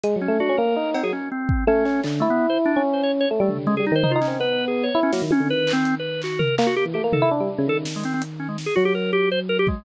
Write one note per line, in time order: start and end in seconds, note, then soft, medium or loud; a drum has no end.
0.04 0.14 G#3 medium
0.04 closed hi-hat medium
0.16 0.27 F#3 medium
0.21 0.38 C#4 medium
0.28 0.39 A3 medium
0.40 0.48 D4 medium
0.40 0.56 F#4 medium
0.49 0.57 C#4 medium
0.57 0.75 A#3 loud
0.57 0.90 A#4 medium
0.76 1.01 D#4 medium
0.94 1.03 C4 medium
0.94 cowbell loud
1.03 1.11 F#3 medium
1.03 1.12 G#4 medium
1.13 1.29 C#4 medium
1.32 1.64 C4 medium
1.49 kick loud
1.67 1.83 A3 loud
1.67 2.01 C#4 loud
1.85 2.02 C#4 medium
1.85 clap medium
2.04 2.20 D3 medium
2.04 clap medium
2.20 2.28 A3 medium
2.20 2.71 E4 loud
2.30 2.47 B3 medium
2.50 2.58 C5 medium
2.66 2.82 D4 loud
2.76 3.25 C#4 medium
2.93 3.02 C5 medium
3.03 3.12 C#5 medium
3.21 3.29 C#5 medium
3.31 3.39 A3 medium
3.40 3.48 G3 loud
3.40 3.57 A3 soft
3.49 3.65 D3 soft
3.49 floor tom medium
3.67 3.78 C#3 medium
3.67 3.75 G#3 loud
3.77 3.90 G3 medium
3.77 3.85 G#4 medium
3.87 3.95 D#4 medium
3.92 4.03 D#3 loud
3.92 4.12 C5 loud
4.03 4.14 D#4 medium
4.03 floor tom loud
4.11 4.20 F4 medium
4.15 4.26 D#4 loud
4.21 4.37 C#4 medium
4.21 clap medium
4.27 4.38 C4 medium
4.40 4.89 B3 medium
4.40 4.65 B4 loud
4.68 4.84 G#4 medium
4.83 5.00 C#5 medium
4.95 5.11 E4 medium
5.03 5.11 C#4 loud
5.12 5.21 F#3 medium
5.12 5.21 A#3 medium
5.12 snare medium
5.22 5.30 D#3 medium
5.31 5.48 C#4 loud
5.31 high tom loud
5.40 5.48 D3 medium
5.49 6.47 D#3 medium
5.49 5.72 B4 loud
5.67 clap loud
5.73 5.95 C4 loud
5.85 closed hi-hat medium
5.99 6.21 B4 medium
6.22 6.40 F#4 medium
6.22 clap medium
6.39 6.55 A#4 medium
6.39 floor tom medium
6.58 6.67 A#3 loud
6.58 clap loud
6.67 6.75 F#4 loud
6.76 6.85 G4 loud
6.85 6.94 E3 soft
6.94 7.03 A3 medium
6.94 7.02 G4 medium
7.04 7.12 A#3 medium
7.13 7.21 D#3 medium
7.13 7.29 A4 medium
7.13 floor tom loud
7.22 7.30 E4 loud
7.31 7.39 D4 medium
7.40 7.48 G3 medium
7.58 7.66 C#3 loud
7.67 8.65 D#3 medium
7.67 7.77 A4 loud
7.85 snare medium
7.96 8.04 G#3 medium
8.04 8.13 C4 medium
8.04 closed hi-hat medium
8.14 8.22 C4 medium
8.22 closed hi-hat medium
8.40 8.48 C#4 medium
8.49 8.57 G#3 medium
8.58 snare medium
8.66 8.74 G#4 medium
8.76 9.75 F#3 medium
8.76 8.84 F#4 loud
8.85 8.93 G4 loud
8.95 9.11 A#4 medium
9.13 9.29 G4 loud
9.32 9.40 C5 loud
9.49 9.57 A#4 loud
9.59 9.67 G4 loud
9.67 9.84 G#3 medium
9.67 kick medium